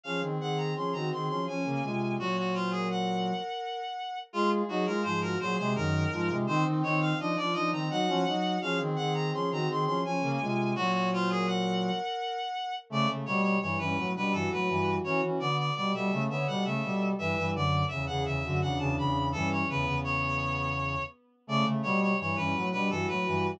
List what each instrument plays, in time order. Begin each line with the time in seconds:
0.03 brass section F3 C#4, violin G#4, clarinet F5
0.21 brass section D#3 C4
0.39 brass section D#3 C4, violin G#4, clarinet F#5
0.57 clarinet A#5
0.75 brass section F3 C#4, violin G#4, clarinet C6
0.93 brass section D#3 C4, violin F#4, clarinet A#5
1.11 brass section D#3 C4, violin G#4, clarinet C6
1.28 brass section F3 C#4, clarinet C6
1.47 brass section F3 C#4, violin C#4, clarinet G#5
1.65 brass section C#3 A#3
1.83 brass section C3 G#3, violin F4
2.18 brass section A#2 F#3, clarinet F#4, violin C#5
2.38 clarinet F#4
2.54 clarinet F4, violin C5
2.71 clarinet G#4, violin A#4
2.90 clarinet F#5
4.33 brass section G#3 F4, clarinet F4, violin G#4
4.68 brass section F#3 D#4, clarinet F#4, violin G#4
4.86 brass section G#3 F4, clarinet A#4
5.03 brass section G#2 F3, violin G#4, clarinet C5
5.21 violin F#4, clarinet A#4
5.40 brass section A#2 F#3, violin G#4, clarinet C5
5.56 brass section C3 G#3, clarinet C5
5.75 brass section F#2 D#3, violin D#4, clarinet A#4
6.11 brass section G#2 F3, violin F4
6.29 brass section C3 G#3
6.47 brass section D#3 C4, violin D#4, clarinet C5
6.65 brass section D#3 C4
6.82 brass section D#3 C4, violin D#4, clarinet C#5
7.00 clarinet F5
7.18 brass section F3 D4, violin D#4, clarinet D#5
7.36 brass section F3 D4, violin F4, clarinet D5
7.53 brass section F3 D4, violin D#4, clarinet D#5
7.72 brass section D#3 C4, clarinet A#5
7.90 brass section F#3 D#4, violin F#4, clarinet F#5
8.07 brass section F3 C#4
8.26 brass section F#3 D#4, violin F#4
8.61 brass section F3 C#4, violin G#4, clarinet F5
8.79 brass section D#3 C4
8.96 brass section D#3 C4, violin G#4, clarinet F#5
9.14 clarinet A#5
9.33 brass section F3 C#4, violin G#4, clarinet C6
9.50 brass section D#3 C4, violin F#4, clarinet A#5
9.68 brass section D#3 C4, violin G#4, clarinet C6
9.85 brass section F3 C#4, clarinet C6
10.04 brass section F3 C#4, violin C#4, clarinet G#5
10.21 brass section C#3 A#3
10.40 brass section C3 G#3, violin F4
10.75 brass section A#2 F#3, clarinet F#4, violin C#5
10.92 clarinet F#4
11.11 clarinet F4, violin C5
11.29 clarinet G#4, violin A#4
11.46 clarinet F#5
12.90 brass section C#3 A3, violin A3, clarinet D5
13.08 brass section C#3 A3
13.26 brass section B2 G3, clarinet C#5
13.42 clarinet C#5
13.61 brass section G2 E3, clarinet C#5
13.78 brass section G2 E3, violin C#4, clarinet B4
13.97 brass section A2 F#3
14.15 brass section B2 G3, violin D4, clarinet B4
14.32 brass section G2 E3, violin F#4, clarinet A4
14.51 brass section A2 F#3, clarinet B4
14.68 brass section G2 E3
15.04 brass section E3 C#4, violin F#4, clarinet C#5
15.22 brass section E3 C#4
15.39 brass section D3 B3, clarinet D5
15.57 clarinet D5
15.75 brass section B2 G3, clarinet D5
15.93 brass section B2 G3, violin A4, clarinet E5
16.11 brass section C#3 A3
16.29 brass section D3 B3, violin C#5, clarinet E5
16.47 brass section B2 G3, violin A4, clarinet F#5
16.65 brass section C#3 A3, clarinet E5
16.83 brass section B2 G3
17.18 brass section G2 E3, violin B4, clarinet E5
17.37 brass section G2 E3
17.54 brass section F#2 D3, clarinet D5
17.88 brass section E2 C#3, clarinet E5
18.06 brass section E2 C#3, violin G#4, clarinet F#5
18.25 brass section E2 C#3, clarinet E5
18.43 brass section F#2 D3, violin F#4
18.61 brass section E2 C#3, violin D4, clarinet F#5
18.79 brass section E2 C#3, clarinet A5
18.97 brass section E2 C#3, clarinet B5
19.32 brass section G2 E3, violin C#4, clarinet A4
19.51 clarinet C#5
19.68 brass section E2 C#3, violin B3, clarinet B4
19.86 brass section E2 C#3
20.04 clarinet C#5
21.47 brass section C#3 A3, violin A3, clarinet D5
21.65 brass section C#3 A3
21.82 brass section B2 G3, clarinet C#5
22.01 clarinet C#5
22.19 brass section G2 E3, clarinet C#5
22.36 brass section G2 E3, violin C#4, clarinet B4
22.54 brass section A2 F#3
22.72 brass section B2 G3, violin D4, clarinet B4
22.90 brass section G2 E3, violin F#4, clarinet A4
23.08 brass section A2 F#3, clarinet B4
23.26 brass section G2 E3